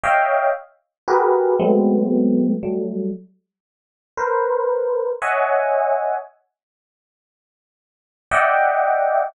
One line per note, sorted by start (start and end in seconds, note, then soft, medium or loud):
0.03 0.50 C#5 medium
0.03 0.50 D#5 medium
0.03 0.50 E5 medium
0.03 0.50 F5 medium
0.03 0.50 G5 medium
1.08 1.54 F#4 medium
1.08 1.54 G4 medium
1.08 1.54 G#4 medium
1.08 1.54 A#4 medium
1.08 1.54 B4 medium
1.59 2.53 F#3 medium
1.59 2.53 G#3 medium
1.59 2.53 A3 medium
1.59 2.53 B3 medium
1.59 2.53 C4 medium
2.63 3.09 F#3 medium
2.63 3.09 G3 medium
2.63 3.09 A3 medium
4.17 5.11 A#4 medium
4.17 5.11 B4 medium
4.17 5.11 C5 medium
5.22 6.15 C#5 medium
5.22 6.15 D#5 medium
5.22 6.15 E5 medium
5.22 6.15 F#5 medium
5.22 6.15 G#5 medium
8.31 9.25 D5 medium
8.31 9.25 D#5 medium
8.31 9.25 E5 medium
8.31 9.25 F#5 medium
8.31 9.25 G5 medium